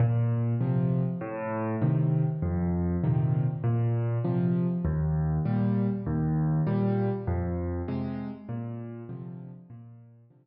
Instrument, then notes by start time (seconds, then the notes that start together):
acoustic grand piano
0.00 A#2
0.61 C3 F3
1.21 A2
1.82 C3 D#3
2.42 F2
3.04 A#2 C3 D#3
3.64 A#2
4.24 C3 F3
4.85 D#2
5.45 A#2 G3
6.06 D#2
6.67 A#2 G3
7.27 F2
7.88 C3 G#3
8.49 A#2
9.09 C3 D3 F3
9.70 A#2
10.30 C3 D3 F3